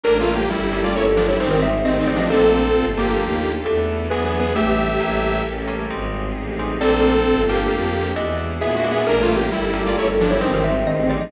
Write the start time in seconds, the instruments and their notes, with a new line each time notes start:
0.03 violin A1, electric piano 2 G3 A3 A#3 C#4, pad 2 (warm) C#4 G4 A4 A#4, lead 2 (sawtooth) D4 A#4, xylophone A#4
0.20 lead 2 (sawtooth) A3 F4
0.35 lead 2 (sawtooth) A#3 G4
0.50 violin G1, lead 2 (sawtooth) G3 E4
0.73 electric piano 2 G3 A3 A#3 C#4
0.83 lead 2 (sawtooth) F4 D5
0.94 violin G1, lead 2 (sawtooth) E4 C#5, xylophone A4
1.06 xylophone A4
1.16 lead 2 (sawtooth) F3 D4
1.27 lead 2 (sawtooth) G3 E4, xylophone C#5
1.40 violin G#1, lead 2 (sawtooth) D#3 C4, electric piano 2 G3 G#3 C4 D#4, pad 2 (warm) C4 D#4 G4 G#4, xylophone C5
1.49 lead 2 (sawtooth) D#3 C4, xylophone A#4
1.62 xylophone E5
1.84 violin A1, lead 2 (sawtooth) D#3 C4, xylophone D#5
1.99 lead 2 (sawtooth) D#3 C4
2.07 electric piano 2 G3 G#3 C4 D#4, xylophone D5
2.15 lead 2 (sawtooth) F3 D4
2.19 xylophone D#5
2.30 violin A#1, electric piano 2 F3 A3 A#3 D4, pad 2 (warm) A#3 D4 F4 A4, lead 2 (sawtooth) C4 A4, xylophone A4
2.75 violin G1
2.97 electric piano 2 F3 A3 A#3 D4, lead 2 (sawtooth) A#3 G4
3.20 violin D#2
3.65 violin E2, electric piano 2 E3 A3 B3 D4, pad 2 (warm) B3 D4 E4 A4, xylophone A4
4.10 violin E2, electric piano 2 E3 F#3 G#3 D4, lead 2 (sawtooth) B3 G#4, pad 2 (warm) D4 E4 F#4 G#4, xylophone B4
4.25 lead 2 (sawtooth) B3 G#4, xylophone B4
4.39 lead 2 (sawtooth) B3 G#4, xylophone B4
4.55 violin A1, electric piano 2 E3 G3 A3 D4, xylophone A3, pad 2 (warm) D4 E4 G4 A4, lead 2 (sawtooth) G4 E5
5.00 violin A1, electric piano 2 G3 A3 A#3 C#4, pad 2 (warm) C#4 G4 A4 A#4
5.46 violin A1
5.67 electric piano 2 G3 A3 A#3 C#4
5.90 violin G#1, electric piano 2 G3 G#3 C4 D#4, pad 2 (warm) C4 D#4 G4 G#4
6.36 violin A1
6.59 electric piano 2 G3 G#3 C4 D#4
6.80 violin A#1, electric piano 2 A3 A#3 D4 F4, pad 2 (warm) A#3 D4 F4 A4, lead 2 (sawtooth) C4 A4, xylophone D5
7.26 violin G1
7.48 electric piano 2 A3 A#3 D4 F4, lead 2 (sawtooth) A#3 G4
7.71 violin F2
8.16 violin E2, electric piano 2 G#3 D4 E4 F#4, pad 2 (warm) D4 E4 F#4 G#4, xylophone D#5
8.61 violin A#2, lead 2 (sawtooth) B3 G#4, xylophone E5
8.75 lead 2 (sawtooth) G#3 F#4, xylophone E5
8.84 electric piano 2 G#3 D4 E4 F#4
8.91 lead 2 (sawtooth) B3 G#4, xylophone E5
9.06 violin A1, electric piano 2 G3 A3 A#3 C#4, pad 2 (warm) C#4 G4 A4 A#4, lead 2 (sawtooth) D4 A#4, xylophone A#4
9.22 lead 2 (sawtooth) A3 F4
9.36 lead 2 (sawtooth) A#3 G4
9.51 violin G1, lead 2 (sawtooth) G3 E4
9.73 electric piano 2 G3 A3 A#3 C#4
9.86 lead 2 (sawtooth) F4 D5
9.96 violin G1, lead 2 (sawtooth) E4 C#5, xylophone A4
10.08 xylophone A4
10.20 lead 2 (sawtooth) F3 D4
10.31 lead 2 (sawtooth) G3 E4, xylophone C#5
10.41 violin G#1, lead 2 (sawtooth) D#3 C4, electric piano 2 G3 G#3 C4 D#4, pad 2 (warm) C4 D#4 G4 G#4, xylophone C5
10.54 lead 2 (sawtooth) D#3 C4, xylophone A#4
10.64 xylophone E5
10.86 violin A1, lead 2 (sawtooth) D#3 C4, xylophone D#5
11.02 lead 2 (sawtooth) D#3 C4
11.09 electric piano 2 G3 G#3 C4 D#4, xylophone D5
11.18 lead 2 (sawtooth) F3 D4, xylophone D#5